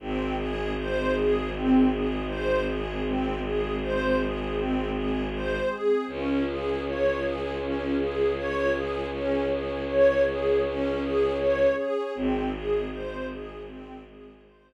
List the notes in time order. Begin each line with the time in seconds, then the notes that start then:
0.00 G#1 C4 D#4 G#4
0.37 G#4
0.78 C5
1.15 G#4
1.52 C4
1.90 G#4
2.27 C5
2.65 G#4
3.04 G#3 C4 G#4
3.42 G#4
3.81 C5
4.19 G#4
4.55 C4
4.92 G#4
5.33 C5
5.69 G#4
6.07 C#2 C#4 F4 G#4
6.46 G#4
6.85 C#5
7.20 G#4
7.60 C#4
7.97 G#4
8.36 C#5
8.72 G#4
9.11 C#4 G#4 C#5
9.50 G#4
9.87 C#5
10.26 G#4
10.65 C#4
11.01 G#4
11.38 C#5
11.76 G#4
12.15 G#1 C4 D#4 G#4
12.53 G#4
12.91 C5
13.28 G#4
13.66 G#3 C4 G#4
14.05 G#4
14.42 C5